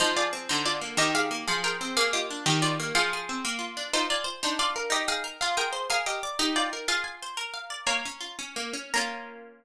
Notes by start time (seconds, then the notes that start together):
0.00 F3 D#4 C5
0.17 F4 G#4 D5
0.33 C4
0.49 D3 D#4 C5
0.66 F4 D5
0.81 A#3
0.97 D#3 G4 D#5
1.15 G4 G#4 F5
1.31 A#3
1.48 F3 G#4 F5
1.64 G#4 A#4 G5
1.81 C4
1.97 A#3 G#4 F5
2.13 F4 G4 D#5
2.30 D4
2.46 D#3 G4 D#5
2.62 F4 G4 D5
2.80 A#3
2.95 F3 G#4 F5
3.13 G#4
3.29 C4
3.45 A#3
3.59 F4
3.77 D4
3.93 D#4 F4 C5
4.10 F4 D5 G#5
4.24 C5
4.43 D4 D#4 C5
4.59 F4 D5 F5
4.76 A#4
4.90 D#4 G4 D#5
5.08 G#4 F5 G5
5.24 A#4
5.41 F4 G#4 F5
5.57 G#4 A#4 G5
5.73 C5
5.90 G#4 A#4 F5
6.06 G4 D#5 F5
6.23 D5
6.39 D#4 G4 D#5
6.56 F4 D5 G5
6.73 A#4
6.88 F4 G#4 F5
7.04 G#5
7.22 C5
7.37 A#4
7.54 F5
7.70 D5
7.87 A#3 C#5 A#5
8.05 C#4
8.21 F4
8.39 C#4
8.56 A#3
8.73 C#4
8.94 A#3 C#4 F4 A#5